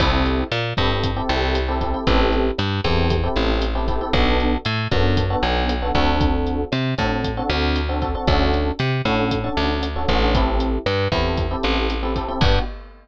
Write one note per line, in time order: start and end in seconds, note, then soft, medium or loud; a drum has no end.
0.00 0.44 C2 loud
0.00 0.41 C4 loud
0.00 0.41 E4 loud
0.00 0.41 G4 loud
0.00 0.41 A4 loud
0.00 kick medium
0.00 cross-stick loud
0.00 crash loud
0.26 closed hi-hat medium
0.52 0.73 A#2 medium
0.52 closed hi-hat medium
0.77 1.22 G2 medium
0.77 1.09 C4 medium
0.77 1.09 E4 medium
0.77 1.09 G4 medium
0.77 1.09 A4 loud
0.77 kick medium
0.77 cross-stick medium
0.77 closed hi-hat medium
1.03 kick medium
1.03 closed hi-hat loud
1.16 1.58 C4 loud
1.16 1.58 E4 medium
1.16 1.58 G4 loud
1.16 1.58 A4 loud
1.29 1.95 C2 loud
1.29 closed hi-hat medium
1.55 cross-stick medium
1.55 closed hi-hat loud
1.68 1.78 C4 medium
1.68 1.78 E4 medium
1.68 1.78 G4 loud
1.68 1.78 A4 loud
1.81 1.91 C4 medium
1.81 1.91 E4 medium
1.81 1.91 G4 medium
1.81 1.91 A4 loud
1.81 kick medium
1.81 closed hi-hat medium
1.94 2.04 C4 medium
1.94 2.04 E4 loud
1.94 2.04 G4 medium
1.94 2.04 A4 medium
2.07 2.51 A1 medium
2.07 2.48 C4 loud
2.07 2.48 E4 loud
2.07 2.48 G4 loud
2.07 2.48 A4 loud
2.07 kick medium
2.07 closed hi-hat loud
2.32 closed hi-hat medium
2.58 2.81 G2 medium
2.58 cross-stick medium
2.58 closed hi-hat medium
2.84 3.28 E2 medium
2.84 3.16 C4 loud
2.84 3.16 E4 medium
2.84 3.16 G4 loud
2.84 3.16 A4 loud
2.84 kick medium
2.84 closed hi-hat medium
3.10 kick medium
3.10 closed hi-hat loud
3.23 3.65 C4 loud
3.23 3.65 E4 medium
3.23 3.65 G4 loud
3.23 3.65 A4 medium
3.36 4.02 A1 medium
3.36 cross-stick medium
3.36 closed hi-hat medium
3.62 closed hi-hat loud
3.75 3.85 C4 loud
3.75 3.85 E4 loud
3.75 3.85 G4 loud
3.75 3.85 A4 medium
3.88 3.98 C4 medium
3.88 3.98 E4 medium
3.88 3.98 G4 loud
3.88 3.98 A4 medium
3.88 kick medium
3.88 closed hi-hat medium
4.01 4.11 C4 medium
4.01 4.11 E4 medium
4.01 4.11 G4 medium
4.01 4.11 A4 loud
4.13 4.57 B1 loud
4.13 4.55 B3 loud
4.13 4.55 D4 loud
4.13 4.55 F#4 loud
4.13 4.55 A4 loud
4.13 kick medium
4.13 cross-stick loud
4.13 closed hi-hat medium
4.40 closed hi-hat medium
4.65 4.88 A2 medium
4.65 closed hi-hat medium
4.91 5.36 F#2 medium
4.91 5.22 B3 loud
4.91 5.22 D4 loud
4.91 5.22 F#4 medium
4.91 5.22 A4 medium
4.91 kick medium
4.91 cross-stick medium
4.91 closed hi-hat medium
5.17 kick medium
5.17 closed hi-hat loud
5.30 5.72 B3 loud
5.30 5.72 D4 medium
5.30 5.72 F#4 loud
5.30 5.72 A4 medium
5.43 5.92 B1 medium
5.43 closed hi-hat medium
5.69 cross-stick medium
5.69 closed hi-hat loud
5.82 5.92 B3 medium
5.82 5.92 D4 medium
5.82 5.92 F#4 medium
5.82 5.92 A4 medium
5.95 6.65 D2 medium
5.95 6.62 C4 loud
5.95 6.62 D4 loud
5.95 6.62 F#4 loud
5.95 6.62 A4 loud
5.95 kick medium
5.95 closed hi-hat medium
6.21 kick medium
6.21 closed hi-hat medium
6.47 closed hi-hat medium
6.72 6.95 C3 medium
6.72 cross-stick medium
6.72 closed hi-hat medium
6.98 7.42 A2 medium
6.98 7.29 C4 medium
6.98 7.29 D4 medium
6.98 7.29 F#4 medium
6.98 7.29 A4 loud
6.98 kick medium
6.98 closed hi-hat medium
7.24 kick medium
7.24 closed hi-hat medium
7.37 7.78 C4 loud
7.37 7.78 D4 medium
7.37 7.78 F#4 loud
7.37 7.78 A4 medium
7.50 8.16 D2 loud
7.50 cross-stick medium
7.50 closed hi-hat medium
7.76 closed hi-hat medium
7.89 7.99 C4 loud
7.89 7.99 D4 medium
7.89 7.99 F#4 medium
7.89 7.99 A4 medium
8.02 8.12 C4 medium
8.02 8.12 D4 medium
8.02 8.12 F#4 medium
8.02 8.12 A4 loud
8.02 kick medium
8.02 closed hi-hat medium
8.15 8.25 C4 medium
8.15 8.25 D4 medium
8.15 8.25 F#4 medium
8.15 8.25 A4 loud
8.27 8.72 D2 medium
8.27 8.69 C#4 loud
8.27 8.69 D4 loud
8.27 8.69 F#4 loud
8.27 8.69 A4 loud
8.27 kick medium
8.27 cross-stick loud
8.27 closed hi-hat medium
8.54 closed hi-hat medium
8.79 9.02 C3 medium
8.79 closed hi-hat medium
9.05 9.49 A2 medium
9.05 9.36 C#4 loud
9.05 9.36 D4 loud
9.05 9.36 F#4 medium
9.05 9.36 A4 loud
9.05 kick medium
9.05 cross-stick medium
9.05 closed hi-hat medium
9.31 kick medium
9.31 closed hi-hat loud
9.44 9.85 C#4 medium
9.44 9.85 D4 loud
9.44 9.85 F#4 medium
9.44 9.85 A4 medium
9.57 10.06 D2 medium
9.57 closed hi-hat medium
9.83 cross-stick medium
9.83 closed hi-hat loud
9.96 10.06 C#4 medium
9.96 10.06 D4 medium
9.96 10.06 F#4 medium
9.96 10.06 A4 medium
10.08 10.79 A1 loud
10.08 10.19 C#4 loud
10.08 10.19 D4 medium
10.08 10.19 F#4 loud
10.08 10.19 A4 medium
10.08 kick medium
10.08 closed hi-hat medium
10.22 10.32 C#4 loud
10.22 10.32 D4 loud
10.22 10.32 F#4 medium
10.22 10.32 A4 loud
10.34 10.76 C4 loud
10.34 10.76 E4 loud
10.34 10.76 G4 loud
10.34 10.76 A4 loud
10.34 kick medium
10.34 closed hi-hat loud
10.60 closed hi-hat medium
10.86 11.08 G2 medium
10.86 cross-stick medium
10.86 closed hi-hat medium
11.12 11.56 E2 medium
11.12 11.43 C4 medium
11.12 11.43 E4 medium
11.12 11.43 G4 medium
11.12 11.43 A4 medium
11.12 kick medium
11.12 closed hi-hat medium
11.37 kick medium
11.37 closed hi-hat medium
11.51 11.92 C4 medium
11.51 11.92 E4 medium
11.51 11.92 G4 medium
11.51 11.92 A4 medium
11.63 12.30 A1 medium
11.63 cross-stick medium
11.63 closed hi-hat medium
11.90 closed hi-hat medium
12.03 12.13 C4 loud
12.03 12.13 E4 medium
12.03 12.13 G4 medium
12.03 12.13 A4 medium
12.16 12.26 C4 medium
12.16 12.26 E4 medium
12.16 12.26 G4 loud
12.16 12.26 A4 loud
12.16 kick medium
12.16 closed hi-hat medium
12.28 12.39 C4 loud
12.28 12.39 E4 medium
12.28 12.39 G4 medium
12.28 12.39 A4 medium
12.41 12.59 G2 loud
12.41 12.59 B3 medium
12.41 12.59 D4 medium
12.41 12.59 F#4 loud
12.41 12.59 G4 loud
12.41 kick loud
12.41 crash loud